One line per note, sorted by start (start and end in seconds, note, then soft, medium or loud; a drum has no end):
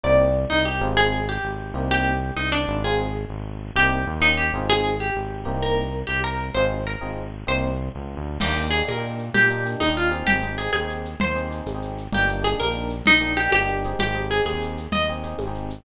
0.03 0.46 C2 loud
0.03 0.25 A#3 medium
0.03 0.25 C4 loud
0.03 0.25 D#4 medium
0.03 0.25 G4 medium
0.03 0.42 D5 medium
0.50 0.80 C2 medium
0.50 0.64 D#4 medium
0.65 0.94 G4 medium
0.81 1.39 G#1 loud
0.81 1.18 C4 loud
0.81 1.18 D#4 medium
0.81 1.18 F4 medium
0.81 1.18 G#4 medium
0.97 1.26 G#4 medium
1.29 1.86 G4 medium
1.43 1.73 G#1 medium
1.74 2.31 C2 medium
1.74 2.12 A#3 loud
1.74 2.12 C4 medium
1.74 2.12 D#4 medium
1.74 2.12 G4 medium
1.91 2.31 G4 medium
2.36 2.66 C2 medium
2.36 2.49 D#4 medium
2.52 2.81 D4 medium
2.68 3.25 G#1 medium
2.84 3.06 C4 medium
2.84 3.06 D#4 medium
2.84 3.06 F4 loud
2.84 3.29 G#4 medium
2.84 3.06 G#4 medium
3.29 3.71 G#1 medium
3.75 4.05 C2 medium
3.75 3.99 A#3 medium
3.75 3.99 C4 medium
3.75 3.99 D#4 medium
3.75 4.18 G4 medium
3.75 3.99 G4 medium
4.07 4.51 D#2 medium
4.20 4.42 A#3 medium
4.20 4.42 C#4 loud
4.20 4.42 D#4 medium
4.20 4.36 D#4 medium
4.20 4.42 G4 medium
4.37 4.64 G4 medium
4.53 5.11 G#1 medium
4.53 4.92 C4 loud
4.53 4.92 D#4 medium
4.53 4.92 F4 medium
4.53 4.92 G#4 loud
4.70 4.96 G#4 medium
5.00 5.61 G4 medium
5.15 5.45 G#1 medium
5.45 6.03 C2 medium
5.45 5.82 A#3 loud
5.45 5.82 C4 loud
5.45 5.82 D#4 loud
5.45 5.82 G4 loud
5.63 6.03 A#4 medium
6.07 6.50 C2 medium
6.07 6.20 G4 medium
6.24 6.49 A#4 medium
6.54 6.97 G#1 medium
6.54 6.78 C4 loud
6.54 6.78 D#4 loud
6.54 6.78 F4 medium
6.54 6.78 G#4 medium
6.54 6.82 C5 medium
6.87 7.43 A#4 medium
7.01 7.44 G#1 medium
7.01 7.23 C4 medium
7.01 7.23 D#4 medium
7.01 7.23 F4 medium
7.01 7.23 G#4 medium
7.47 7.90 C2 medium
7.47 7.69 A#3 medium
7.47 7.69 C4 medium
7.47 7.69 D#4 medium
7.47 7.69 G4 medium
7.47 7.90 C5 medium
7.95 8.16 C#2 medium
8.17 8.38 D2 medium
8.40 8.83 D#2 loud
8.40 8.53 A#3 medium
8.40 8.53 D4 medium
8.40 8.53 D#4 medium
8.40 8.53 G4 medium
8.40 8.71 G4 medium
8.40 crash loud
8.40 low conga loud
8.40 shaker medium
8.56 8.69 A#3 medium
8.56 8.69 D4 medium
8.56 8.69 D#4 medium
8.56 8.69 G4 medium
8.56 shaker medium
8.71 8.91 A#3 medium
8.71 8.91 D4 medium
8.71 8.91 D#4 medium
8.71 8.91 G4 medium
8.71 8.84 G#4 medium
8.71 shaker medium
8.87 9.30 A#2 medium
8.87 9.27 A#4 medium
8.87 high conga medium
8.87 shaker medium
8.96 9.21 A#3 medium
8.96 9.21 D4 medium
8.96 9.21 D#4 medium
8.96 9.21 G4 medium
9.03 shaker medium
9.19 shaker medium
9.34 9.76 A#2 medium
9.34 9.78 G4 medium
9.34 low conga loud
9.34 shaker medium
9.50 9.63 A#3 medium
9.50 9.63 D4 medium
9.50 9.63 D#4 medium
9.50 9.63 G4 medium
9.50 shaker medium
9.65 9.84 A#3 medium
9.65 9.84 D4 medium
9.65 9.84 D#4 medium
9.65 9.84 G4 medium
9.65 shaker medium
9.80 10.23 D#2 medium
9.80 9.93 D#4 medium
9.80 high conga medium
9.80 shaker medium
9.88 10.10 A#3 medium
9.88 10.10 D4 medium
9.88 10.10 D#4 medium
9.88 10.10 G4 medium
9.96 10.24 F4 medium
9.96 shaker medium
10.11 10.39 C4 medium
10.11 10.39 D#4 medium
10.11 10.39 G4 medium
10.11 10.39 G#4 medium
10.11 shaker medium
10.26 10.68 G#1 medium
10.26 10.56 G4 medium
10.26 low conga loud
10.26 shaker medium
10.42 10.55 C4 medium
10.42 10.55 D#4 medium
10.42 10.55 G4 medium
10.42 10.55 G#4 medium
10.42 shaker medium
10.58 10.77 C4 medium
10.58 10.77 D#4 medium
10.58 10.77 G4 medium
10.58 10.71 G#4 medium
10.58 10.77 G#4 medium
10.58 shaker medium
10.72 11.15 D#2 medium
10.72 11.14 G#4 medium
10.72 high conga medium
10.72 shaker medium
10.81 11.06 C4 medium
10.81 11.06 D#4 medium
10.81 11.06 G4 medium
10.81 11.06 G#4 medium
10.89 shaker medium
11.05 shaker medium
11.20 11.62 D#2 medium
11.20 11.61 C5 medium
11.20 low conga loud
11.20 shaker medium
11.35 11.47 C4 medium
11.35 11.47 D#4 medium
11.35 11.47 G4 medium
11.35 11.47 G#4 medium
11.35 shaker medium
11.50 11.69 C4 medium
11.50 11.69 D#4 medium
11.50 11.69 G4 medium
11.50 11.69 G#4 medium
11.50 shaker medium
11.66 12.08 G#1 medium
11.66 high conga medium
11.66 shaker medium
11.75 11.99 C4 medium
11.75 11.99 D#4 medium
11.75 11.99 G4 medium
11.75 11.99 G#4 medium
11.82 shaker medium
11.98 shaker medium
12.12 12.55 G1 medium
12.12 12.25 A#3 medium
12.12 12.25 D4 medium
12.12 12.25 D#4 medium
12.12 12.25 G4 medium
12.12 12.40 G4 medium
12.12 low conga loud
12.12 shaker medium
12.28 12.41 A#3 medium
12.28 12.41 D4 medium
12.28 12.41 D#4 medium
12.28 12.41 G4 medium
12.28 shaker medium
12.42 12.61 A#3 medium
12.42 12.61 D4 medium
12.42 12.61 D#4 medium
12.42 12.61 G4 medium
12.42 12.57 G#4 medium
12.42 shaker medium
12.60 13.02 A#1 medium
12.60 13.00 A#4 medium
12.60 high conga medium
12.60 shaker medium
12.66 12.91 A#3 medium
12.66 12.91 D4 medium
12.66 12.91 D#4 medium
12.66 12.91 G4 medium
12.74 shaker medium
12.90 shaker medium
13.06 13.48 A#1 medium
13.06 13.34 D#4 medium
13.06 low conga loud
13.06 shaker medium
13.21 13.33 A#3 medium
13.21 13.33 D4 medium
13.21 13.33 D#4 medium
13.21 13.33 G4 medium
13.21 shaker medium
13.37 13.55 A#3 medium
13.37 13.55 D4 medium
13.37 13.55 D#4 medium
13.37 13.51 G4 medium
13.37 13.55 G4 medium
13.37 shaker medium
13.52 13.95 G1 medium
13.52 13.94 G4 medium
13.52 high conga medium
13.52 shaker medium
13.61 13.83 A#3 medium
13.61 13.83 D4 medium
13.61 13.83 D#4 medium
13.61 13.83 G4 medium
13.68 shaker medium
13.84 14.13 C4 medium
13.84 14.13 D#4 medium
13.84 14.13 G4 medium
13.84 14.13 G#4 medium
13.84 shaker medium
13.99 14.41 G#1 medium
13.99 14.29 G4 medium
13.99 low conga loud
13.99 shaker medium
14.14 14.27 C4 medium
14.14 14.27 D#4 medium
14.14 14.27 G4 medium
14.14 14.27 G#4 medium
14.14 shaker medium
14.30 14.49 C4 medium
14.30 14.49 D#4 medium
14.30 14.49 G4 medium
14.30 14.49 G#4 medium
14.30 14.45 G#4 medium
14.30 shaker medium
14.45 14.87 D#2 medium
14.45 14.89 G#4 medium
14.45 high conga loud
14.45 shaker medium
14.53 14.78 C4 medium
14.53 14.78 D#4 medium
14.53 14.78 G4 medium
14.53 14.78 G#4 medium
14.61 shaker medium
14.77 shaker medium
14.92 15.34 D#2 medium
14.92 15.31 D#5 medium
14.92 low conga loud
14.92 shaker medium
15.08 15.22 C4 medium
15.08 15.22 D#4 medium
15.08 15.22 G4 medium
15.08 15.22 G#4 medium
15.08 shaker medium
15.23 15.42 C4 medium
15.23 15.42 D#4 medium
15.23 15.42 G4 medium
15.23 15.42 G#4 medium
15.23 shaker medium
15.38 15.81 G#1 medium
15.38 high conga medium
15.38 shaker medium
15.47 15.72 C4 medium
15.47 15.72 D#4 medium
15.47 15.72 G4 medium
15.47 15.72 G#4 medium
15.55 shaker medium
15.70 shaker loud